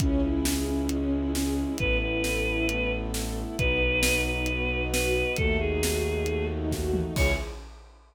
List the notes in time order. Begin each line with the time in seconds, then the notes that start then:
0.00 C#2 C#4 E4 G#4, kick, closed hi-hat
0.23 E4
0.45 G#4, snare
0.67 C#4 E4
0.89 G#3 C#4 G#4, closed hi-hat
1.11 E4
1.34 C#4 G#4, snare
1.58 E4
1.77 A1 B3 E4 A4 B4, kick, closed hi-hat
2.01 E4 B4
2.24 A4, snare
2.45 E4
2.68 A3 B3 A4, closed hi-hat
2.91 E4
3.13 A4, snare
3.37 E4
3.58 B1 B3 D#4 F#4 B4, kick, closed hi-hat
3.81 D#4
4.03 F#4, snare
4.25 D#4 B4
4.46 B3 F#4 B4, closed hi-hat
4.68 D#4
4.92 F#4 B4, snare
5.14 D#4
5.36 D#2 A3 D#4 F#4 A4, kick, closed hi-hat
5.59 D#4 G#4
5.83 F#4, snare
6.04 D#4
6.26 A3 F#4 A4, closed hi-hat
6.49 D#4
6.71 F#4, kick, snare
6.93 D#4, mid tom
7.16 C#2 C#4 E4 G#4 C#5, kick, crash